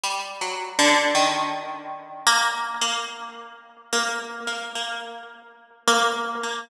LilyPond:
\new Staff { \time 5/8 \partial 4 \tempo 4 = 54 \tuplet 3/2 { g8 ges8 d8 } | ees4 bes8 bes16 r8. | bes8 bes16 bes16 r8. bes8 bes16 | }